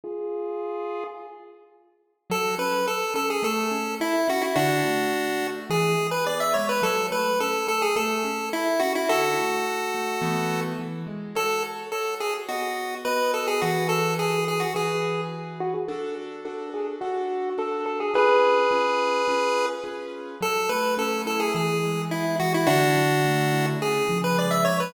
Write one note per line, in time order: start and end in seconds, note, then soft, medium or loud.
0.04 1.04 F4 medium
0.04 1.04 G#4 loud
2.30 2.55 F#3 loud
2.30 2.55 A4 loud
2.58 2.84 C#4 loud
2.58 2.86 B4 medium
2.86 3.12 A4 medium
2.86 3.14 A4 loud
3.14 3.40 C#4 medium
3.14 3.29 A4 loud
3.30 3.44 G#4 medium
3.43 3.68 A3 loud
3.43 3.95 A4 loud
3.71 3.97 C#4 loud
4.00 4.26 E4 loud
4.00 4.28 E4 loud
4.28 4.54 C#4 medium
4.28 4.43 F#4 loud
4.42 4.55 E4 loud
4.56 4.81 D3 loud
4.56 5.47 D4 loud
4.56 5.47 F#4 loud
4.84 5.10 A3 medium
5.13 5.38 F#4 medium
5.42 5.67 A3 medium
5.70 5.95 E3 loud
5.70 6.07 G#4 loud
5.98 6.23 G#3 medium
6.11 6.25 B4 loud
6.26 6.52 B3 medium
6.26 6.40 D5 loud
6.40 6.54 E5 loud
6.54 6.81 G#3 loud
6.54 6.67 C#5 medium
6.69 6.82 B4 loud
6.82 7.08 F#3 loud
6.82 7.07 A4 loud
7.11 7.36 A3 loud
7.11 7.39 B4 loud
7.40 7.66 C#4 medium
7.40 7.67 A4 loud
7.67 7.93 A3 medium
7.67 7.82 A4 loud
7.82 7.95 G#4 loud
7.96 8.21 A3 loud
7.96 8.49 A4 loud
8.24 8.50 C#4 loud
8.53 8.78 E4 medium
8.53 8.81 E4 loud
8.80 9.06 C#4 medium
8.80 8.93 F#4 loud
8.95 9.09 E4 loud
9.09 9.35 D3 loud
9.09 10.61 F#4 loud
9.09 10.61 A4 loud
9.38 9.64 A3 medium
9.67 9.92 F#4 medium
9.94 10.20 A3 medium
10.22 10.73 E3 loud
10.22 10.73 A3 loud
10.22 10.73 B3 loud
10.79 11.04 E3 loud
11.06 11.32 G#3 medium
11.35 11.86 F#4 medium
11.35 11.86 A4 medium
11.35 11.63 A4 loud
11.35 11.86 C#5 medium
11.92 12.44 F#4 medium
11.92 12.15 A4 medium
11.92 12.44 A4 medium
11.92 12.44 C#5 medium
12.20 12.34 G#4 medium
12.48 12.99 B3 medium
12.48 12.95 F#4 medium
12.48 12.99 F#4 medium
12.48 12.99 D#5 loud
13.05 13.56 B3 medium
13.05 13.56 F#4 medium
13.05 13.32 B4 loud
13.05 13.56 D#5 medium
13.34 13.47 A4 medium
13.47 13.61 G#4 loud
13.62 14.64 E3 medium
13.62 13.88 F#4 loud
13.62 14.64 F#4 loud
13.62 14.64 G#4 medium
13.62 14.64 B4 medium
13.89 14.14 A4 loud
14.19 14.45 G#4 loud
14.48 14.61 G#4 medium
14.60 14.73 F#4 medium
14.74 15.76 E3 medium
14.74 15.76 F#4 medium
14.74 15.76 G#4 medium
14.74 15.21 G#4 medium
14.74 15.76 B4 medium
15.60 15.74 F#4 loud
15.74 15.88 G#4 loud
15.88 16.39 D4 medium
15.88 16.39 F#4 medium
15.88 16.15 A4 loud
15.88 16.39 A4 medium
16.45 16.96 D4 medium
16.45 16.96 F#4 medium
16.45 16.70 A4 loud
16.45 16.96 A4 medium
16.74 16.87 G#4 medium
17.01 17.52 D4 medium
17.01 17.50 F#4 loud
17.01 17.52 F#4 medium
17.01 17.52 A4 medium
17.58 18.09 D4 medium
17.58 18.09 F#4 medium
17.58 18.09 A4 medium
17.58 17.85 A4 medium
17.86 17.99 A4 loud
18.00 18.14 G#4 loud
18.14 18.65 C#4 medium
18.14 18.65 F4 medium
18.14 18.65 G#4 medium
18.14 19.66 G#4 loud
18.14 18.65 B4 medium
18.14 19.66 B4 loud
18.71 19.22 C#4 medium
18.71 19.22 F4 medium
18.71 19.22 G#4 medium
18.71 19.22 B4 medium
19.28 19.79 C#4 medium
19.28 19.79 F4 medium
19.28 19.79 G#4 medium
19.28 19.79 B4 medium
19.84 20.35 C#4 medium
19.84 20.35 F4 medium
19.84 20.35 G#4 medium
19.84 20.35 B4 medium
20.41 21.48 F#3 loud
20.41 20.70 A4 loud
20.69 21.50 A3 loud
20.69 20.94 B4 medium
20.97 21.51 C#4 loud
20.97 21.22 A4 loud
21.26 21.53 E4 medium
21.26 21.40 A4 loud
21.40 21.53 G#4 medium
21.54 22.39 E3 loud
21.54 22.02 G#4 medium
21.83 22.63 G#3 medium
22.10 22.64 B3 medium
22.10 22.36 E4 loud
22.40 22.67 E3 medium
22.40 22.53 F#4 loud
22.54 22.68 E4 loud
22.67 23.75 D3 loud
22.67 23.66 D4 loud
22.67 23.66 F#4 loud
22.96 23.76 F#3 loud
23.25 23.79 A3 medium
23.52 23.79 E4 medium
23.81 24.65 C#3 loud
23.81 24.18 G#4 loud
24.09 24.89 F3 loud
24.24 24.37 B4 loud
24.38 24.91 G#3 medium
24.38 24.52 D5 medium
24.51 24.64 E5 loud
24.65 24.92 C#3 medium
24.65 24.78 C#5 loud
24.80 24.93 B4 medium